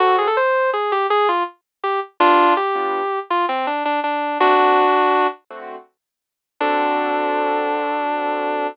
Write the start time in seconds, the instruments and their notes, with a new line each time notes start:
0.00 acoustic grand piano D3 C4 F#4 A4, distortion guitar F#4
0.18 distortion guitar G#4
0.27 distortion guitar A4
0.37 distortion guitar C5
0.73 distortion guitar G#4
0.92 distortion guitar G4
1.10 distortion guitar G#4
1.29 distortion guitar F4
1.83 distortion guitar G4
2.20 acoustic grand piano G3 B3 D4 F4, distortion guitar D4 F4
2.57 distortion guitar G4
2.75 acoustic grand piano G3 B3 D4 F4
3.30 distortion guitar F4
3.49 distortion guitar C4
3.67 distortion guitar D4
3.85 distortion guitar D4
4.04 distortion guitar D4
4.40 acoustic grand piano D3 A3 C4 F#4, distortion guitar D4 F#4
4.58 acoustic grand piano D3 A3 C4 F#4
5.50 acoustic grand piano D3 A3 C4 F#4
6.60 acoustic grand piano D3 C4 F#4 A4, distortion guitar D4